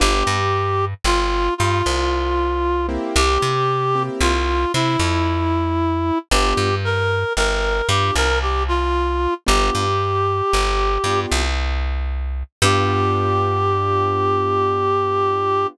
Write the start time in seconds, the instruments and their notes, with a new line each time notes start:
0.00 electric bass (finger) G1, acoustic grand piano B3 D4 F4 G4, clarinet G4
0.27 electric bass (finger) G2
1.04 electric bass (finger) G1, clarinet F4
1.58 electric bass (finger) G2, clarinet F4
1.86 electric bass (finger) C2
2.89 acoustic grand piano A#3 C4 E4 G4
3.16 electric bass (finger) C2, clarinet G4
3.42 electric bass (finger) C3
3.95 acoustic grand piano A#3 C4 E4 G4
4.21 electric bass (finger) C2, clarinet F4
4.74 electric bass (finger) C3, clarinet E4
4.99 electric bass (finger) F2
6.31 electric bass (finger) G1, acoustic grand piano B3 D4 F4 G4, clarinet G4
6.57 electric bass (finger) G2
6.85 clarinet A#4
7.37 electric bass (finger) G1, clarinet A#4
7.89 electric bass (finger) G2, acoustic grand piano B3 D4 F4 G4, clarinet G4
8.15 electric bass (finger) C2, clarinet A#4
8.42 clarinet G4
8.68 clarinet F4
9.46 electric bass (finger) G1, acoustic grand piano B3 D4 F4 G4, clarinet G4
9.75 electric bass (finger) G2
10.53 electric bass (finger) G1
11.04 electric bass (finger) G2, acoustic grand piano B3 D4 F4 G4
11.32 electric bass (finger) C2
12.62 electric bass (finger) G2, acoustic grand piano B3 D4 F4 G4, clarinet G4